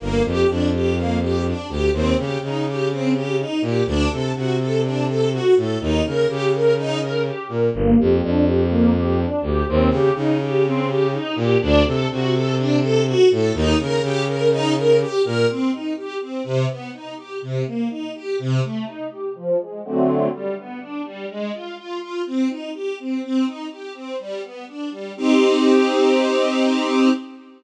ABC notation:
X:1
M:4/4
L:1/8
Q:1/4=124
K:Gm
V:1 name="String Ensemble 1"
B, G D G B, G D G | C G E G C G E G | D A ^F A D A F A | E B G B E B G B |
B, G D G B, G D G | C G E G C G E G | D A ^F A D A F A | E B G B E B G B |
[K:Cm] C E G C C, =B, E G | C, B, E G C, =A, E G | F, A, [D,^F,=A,C]2 G, =B, D G, | A, F F F C E G C |
C E G C G, =B, D G, | [CEG]8 |]
V:2 name="Violin" clef=bass
G,,, F,, F,,5 D,, | E,, _D, D,5 B,, | D,, C, C,5 A,, | E,, _D, D,5 B,, |
G,,, F,, F,,5 D,, | E,, _D, D,5 B,, | D,, C, C,5 A,, | E,, _D, D,5 B,, |
[K:Cm] z8 | z8 | z8 | z8 |
z8 | z8 |]